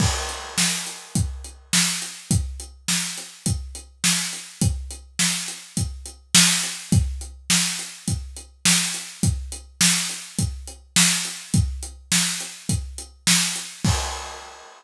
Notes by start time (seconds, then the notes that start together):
0.00 kick, crash
0.29 closed hi-hat
0.58 snare
0.87 closed hi-hat
1.15 kick, closed hi-hat
1.44 closed hi-hat
1.73 snare
2.02 closed hi-hat
2.31 kick, closed hi-hat
2.60 closed hi-hat
2.88 snare
3.18 closed hi-hat
3.46 kick, closed hi-hat
3.75 closed hi-hat
4.04 snare
4.33 closed hi-hat
4.61 kick, closed hi-hat
4.91 closed hi-hat
5.19 snare
5.48 closed hi-hat
5.77 kick, closed hi-hat
6.06 closed hi-hat
6.35 snare
6.63 closed hi-hat
6.92 kick, closed hi-hat
7.21 closed hi-hat
7.50 snare
7.79 closed hi-hat
8.08 kick, closed hi-hat
8.37 closed hi-hat
8.65 snare
8.94 closed hi-hat
9.23 kick, closed hi-hat
9.52 closed hi-hat
9.81 snare
10.09 closed hi-hat
10.39 kick, closed hi-hat
10.67 closed hi-hat
10.96 snare
11.25 closed hi-hat
11.54 kick, closed hi-hat
11.83 closed hi-hat
12.12 snare
12.40 closed hi-hat
12.69 kick, closed hi-hat
12.98 closed hi-hat
13.27 snare
13.56 closed hi-hat
13.84 kick, crash